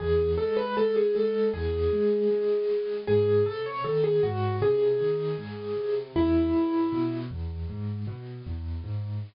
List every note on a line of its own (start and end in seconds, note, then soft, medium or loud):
0.00 0.35 E2 loud
0.00 0.31 G#4 medium
0.38 0.74 G#3 medium
0.38 0.56 A4 medium
0.57 0.75 B4 medium
0.77 1.12 G#3 medium
0.77 0.95 A4 medium
0.96 1.15 G#4 medium
1.15 1.50 G#3 medium
1.15 1.47 A4 medium
1.54 1.88 E2 medium
1.54 2.97 G#4 medium
1.92 2.27 G#3 medium
2.31 2.65 G#3 medium
2.69 3.04 G#3 medium
3.07 3.43 G#2 medium
3.07 3.44 G#4 medium
3.46 3.81 C3 medium
3.46 3.64 A4 medium
3.66 3.84 C#5 medium
3.84 4.19 D#3 medium
3.84 4.03 A4 medium
4.04 4.22 G#4 medium
4.23 4.58 G#2 medium
4.23 4.56 F#4 medium
4.62 4.96 C3 medium
4.62 5.95 G#4 medium
5.00 5.35 D#3 medium
5.38 5.72 G#2 medium
5.77 6.12 C3 medium
6.16 6.50 E2 medium
6.16 7.16 E4 medium
6.54 6.88 G#2 medium
6.92 7.27 B2 medium
7.31 7.66 E2 medium
7.69 8.04 G#2 medium
8.07 8.42 B2 medium
8.46 8.81 E2 medium
8.84 9.19 G#2 medium